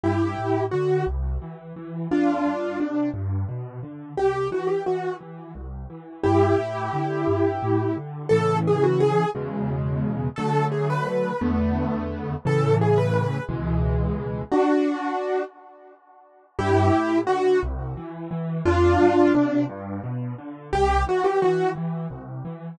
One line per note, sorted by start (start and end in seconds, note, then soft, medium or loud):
0.04 0.35 G2 medium
0.04 0.64 E4 medium
0.04 0.64 G4 medium
0.39 0.69 A2 medium
0.71 1.04 D3 medium
0.71 1.05 F#4 medium
1.07 1.38 C2 medium
1.42 1.73 E3 medium
1.76 2.07 E3 medium
2.11 2.42 F2 medium
2.11 2.78 D4 medium
2.11 2.78 F4 medium
2.45 2.76 G2 medium
2.80 3.11 C3 medium
2.80 3.09 D4 medium
3.14 3.45 G2 medium
3.49 3.80 B2 medium
3.83 4.14 D3 medium
4.17 4.48 C2 medium
4.17 4.48 G4 medium
4.51 4.82 E3 medium
4.51 4.69 F#4 medium
4.67 4.84 G4 medium
4.86 5.18 E3 medium
4.86 5.14 F#4 medium
5.21 5.52 E3 medium
5.55 5.86 C2 medium
5.90 6.21 E3 medium
6.24 6.55 G2 medium
6.24 7.96 E4 medium
6.24 7.96 G4 medium
6.59 6.90 A2 medium
6.93 7.24 D3 medium
7.28 7.59 G2 medium
7.62 7.94 A2 medium
7.97 8.28 D3 medium
8.29 9.24 A2 medium
8.29 9.24 C#3 medium
8.29 9.24 E3 medium
8.29 8.57 A4 loud
8.67 8.84 G#4 medium
8.83 9.00 F#4 medium
9.00 9.29 G#4 loud
9.35 10.28 E2 medium
9.35 10.28 B2 medium
9.35 10.28 C#3 medium
9.35 10.28 G#3 medium
10.36 11.31 D3 medium
10.36 11.31 F#3 medium
10.36 11.31 A3 medium
10.36 10.65 A4 loud
10.72 10.88 G#4 medium
10.90 11.06 B4 medium
11.07 11.40 B4 medium
11.41 12.34 E2 medium
11.41 12.34 D3 medium
11.41 12.34 A3 medium
11.41 12.34 B3 medium
12.45 13.38 A2 medium
12.45 13.38 C#3 medium
12.45 13.38 E3 medium
12.45 12.75 A4 loud
12.81 12.98 G#4 medium
12.98 13.13 B4 medium
13.14 13.43 B4 medium
13.49 14.42 C#2 medium
13.49 14.42 B2 medium
13.49 14.42 E3 medium
13.49 14.42 G#3 medium
14.52 15.42 D4 medium
14.52 15.42 F#4 medium
16.59 16.90 G2 loud
16.59 17.19 E4 medium
16.59 17.19 G4 loud
16.93 17.24 A2 medium
17.27 17.58 D3 medium
17.27 17.60 F#4 loud
17.63 17.94 C2 loud
17.97 18.28 E3 medium
18.31 18.62 E3 medium
18.65 18.96 F2 loud
18.65 19.32 D4 loud
18.65 19.32 F4 loud
19.00 19.31 G2 medium
19.34 19.66 C3 medium
19.34 19.64 D4 medium
19.69 20.00 G2 loud
20.04 20.35 B2 medium
20.38 20.69 D3 medium
20.73 21.04 C2 medium
20.73 21.03 G4 loud
21.07 21.38 E3 medium
21.07 21.25 F#4 loud
21.24 21.41 G4 medium
21.42 21.73 E3 medium
21.42 21.70 F#4 medium
21.76 22.07 E3 medium
22.10 22.41 C2 medium
22.45 22.76 E3 medium